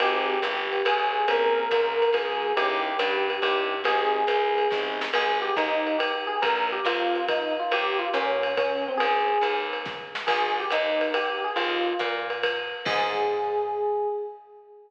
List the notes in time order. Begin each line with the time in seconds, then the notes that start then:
0.00 G#1 C4 D#4 G4 G#4, ride
0.42 G1, hi-hat pedal, ride
0.73 ride
0.85 B1 G#4, ride
1.28 A#1 A#3 C4 C#4 G#4 A#4, ride
1.71 C#2, kick, hi-hat pedal, ride
2.02 ride
2.13 D2 G#4, kick, ride
2.57 D#2 C#4 D#4 E4 G4, ride
2.99 G2, hi-hat pedal, ride
3.30 ride
3.42 G2 C#4 D#4 E4 G4, ride
3.84 G#1 C4 D#4 G4 G#4, ride
4.27 C2, hi-hat pedal, ride
4.58 ride
4.71 A1 C4 D#4 G4 G#4, kick, snare
5.01 snare
5.13 G#1 G#4, crash, ride
5.42 G4
5.56 D#2 D#4, kick, hi-hat pedal, ride
5.87 ride
5.99 G4, ride
6.27 G#4
6.42 A#1 A#4, kick, ride
6.72 G4
6.85 F2 F4, hi-hat pedal, ride
7.15 ride
7.28 D#4, kick, ride
7.60 F4
7.71 D#2 G4, ride
7.99 F4
8.13 A#2 C#4, hi-hat pedal, ride
8.43 ride
8.57 C#4, kick, ride
8.88 C4
8.97 G#1 G#4, ride
9.41 D#2, hi-hat pedal, ride
9.73 ride
9.86 kick, snare
10.15 snare
10.27 G#1 G#4, kick, crash, ride
10.60 G4
10.70 D#2 D#4, hi-hat pedal, ride
11.01 ride
11.14 G4, ride
11.44 G#4
11.56 D#2 F4, ride
11.99 A#2, kick, hi-hat pedal, ride
12.30 ride
12.43 kick, ride
12.85 G#2 G#4, kick, crash